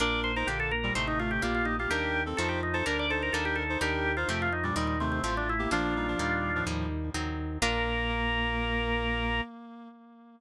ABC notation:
X:1
M:4/4
L:1/16
Q:1/4=126
K:Bb
V:1 name="Drawbar Organ"
d2 c B G A B2 c E F G F F E F | G3 z A G E A B d A B A G A2 | G3 F G F E D E E C C C D =E2 | [DF]8 z8 |
B16 |]
V:2 name="Clarinet"
[DB]3 [Ec] [D,B,]2 z [B,,G,] [C,A,]2 [C,A,]2 [B,G]3 [B,G] | [DB]3 [CA] [Ec]2 z [Ec] [DB]2 [Ec]2 [DB]3 [Ec] | [DB]3 [Ec] [C,A,]2 z [B,,G,] [B,,G,]2 [C,A,]2 [A,F]3 [B,G] | [F,D]2 [G,E] [F,D] [B,,G,]3 [A,,F,]3 z6 |
B,16 |]
V:3 name="Acoustic Guitar (steel)"
[B,DF]4 [B,DG]4 [A,CE]4 [G,B,D]4 | [G,B,E]4 [F,A,C]4 [G,B,D]4 [G,B,E]4 | [G,B,E]4 [F,A,C]4 [E,G,C]4 [F,A,C]4 | [F,B,D]4 [G,B,E]4 [G,B,E]4 [_G,CE]4 |
[B,DF]16 |]
V:4 name="Drawbar Organ" clef=bass
B,,,4 B,,,4 A,,,4 B,,,4 | E,,4 F,,4 D,,4 E,,4 | E,,4 F,,4 E,,4 A,,,4 | B,,,4 E,,4 E,,4 E,,4 |
B,,,16 |]